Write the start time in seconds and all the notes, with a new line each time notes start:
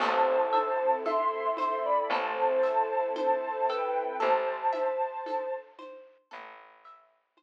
0.00 A1 C4 E4 A4 C5 A5, crash, low conga, shaker
0.52 E5, high conga, shaker
1.05 A4 E5 C6, high conga, shaker
1.57 C5 E5 C6, high conga, shaker
1.85 D5 B5
2.10 A1 A4 C5 A5, low conga, shaker
2.63 E5, shaker
3.16 C5 A5, high conga, shaker
3.68 A4 B4 G5, shaker
4.20 A1 A4 C5 A5, low conga, shaker
4.73 E5, high conga, shaker
5.26 A4, high conga, shaker
5.79 C5, high conga, shaker
6.31 A1 A4, low conga, shaker
6.84 E5, shaker
7.37 C5, high conga, shaker